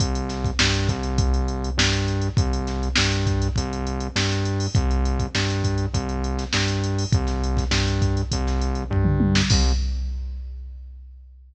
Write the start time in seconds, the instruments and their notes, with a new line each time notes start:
0.00 synth bass 1 C2, kick, closed hi-hat
0.15 closed hi-hat
0.29 snare, closed hi-hat
0.44 kick, closed hi-hat
0.59 synth bass 1 G2, snare
0.74 closed hi-hat
0.89 synth bass 1 C2, kick, closed hi-hat
1.03 closed hi-hat
1.18 kick, closed hi-hat
1.34 closed hi-hat
1.48 closed hi-hat
1.64 closed hi-hat
1.77 synth bass 1 G2, snare
1.93 closed hi-hat
2.08 closed hi-hat
2.22 closed hi-hat
2.37 synth bass 1 C2, kick, closed hi-hat
2.53 closed hi-hat
2.67 snare, closed hi-hat
2.83 closed hi-hat
2.96 synth bass 1 G2, snare
3.12 closed hi-hat
3.27 kick, closed hi-hat
3.42 closed hi-hat
3.56 synth bass 1 C2, kick, closed hi-hat
3.73 closed hi-hat
3.87 closed hi-hat
4.00 closed hi-hat
4.16 synth bass 1 G2, snare
4.29 snare, closed hi-hat
4.45 closed hi-hat
4.60 open hi-hat
4.75 synth bass 1 C2, kick, closed hi-hat
4.91 closed hi-hat
5.05 closed hi-hat
5.19 kick, closed hi-hat
5.35 synth bass 1 G2, snare
5.50 closed hi-hat
5.64 kick, closed hi-hat
5.78 closed hi-hat
5.94 synth bass 1 C2, kick, closed hi-hat
6.09 closed hi-hat
6.24 closed hi-hat
6.39 snare, closed hi-hat
6.53 synth bass 1 G2, snare
6.68 closed hi-hat
6.84 closed hi-hat
6.98 open hi-hat
7.12 synth bass 1 C2, kick, closed hi-hat
7.27 snare, closed hi-hat
7.44 closed hi-hat
7.57 kick, snare, closed hi-hat
7.71 synth bass 1 G2, snare
7.88 closed hi-hat
8.02 kick, closed hi-hat
8.17 closed hi-hat
8.32 synth bass 1 C2, kick, closed hi-hat
8.47 snare, closed hi-hat
8.61 closed hi-hat
8.75 closed hi-hat
8.90 synth bass 1 G2, kick, floor tom
9.05 mid tom
9.20 high tom
9.35 snare
9.50 synth bass 1 C2, kick, crash